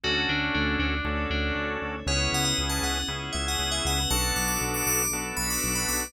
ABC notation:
X:1
M:4/4
L:1/16
Q:1/4=118
K:Bdor
V:1 name="Tubular Bells"
F2 D2 D2 D4 D3 z3 | c2 f f z a f2 z2 e f2 e f2 | a2 d' d' z d' d'2 z2 b d'2 b d'2 |]
V:2 name="Drawbar Organ"
[CDFA]8 [CDFA]8 | [B,CEG]8 [B,CEG]8 | [B,DFA]8 [B,DFA]8 |]
V:3 name="Synth Bass 1" clef=bass
D,,2 D,,2 D,,2 D,,2 D,,2 D,,2 D,,2 D,,2 | C,,2 C,,2 C,,2 C,,2 C,,2 C,,2 C,,2 C,,2 | B,,,2 B,,,2 B,,,2 B,,,2 B,,,2 B,,,2 B,,,2 B,,,2 |]
V:4 name="Pad 5 (bowed)"
[CDFA]8 [CDAc]8 | [B,CEG]8 [B,CGB]8 | [B,DFA]8 [B,DAB]8 |]